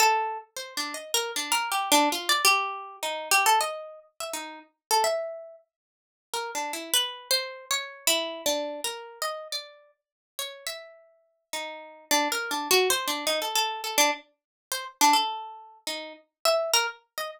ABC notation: X:1
M:2/4
L:1/16
Q:1/4=104
K:none
V:1 name="Pizzicato Strings"
A3 z (3c2 D2 _e2 | (3_B2 D2 B2 (3G2 D2 F2 | d G4 _E2 G | A _e3 z =e _E2 |
z2 A e4 z | z4 (3_B2 D2 E2 | (3B4 c4 _d4 | (3E4 D4 _B4 |
_e2 d3 z3 | _d2 e6 | _E4 (3D2 _B2 D2 | (3_G2 c2 D2 _E A A2 |
A D z4 c z | D A5 _E2 | z2 e2 _B z2 _e |]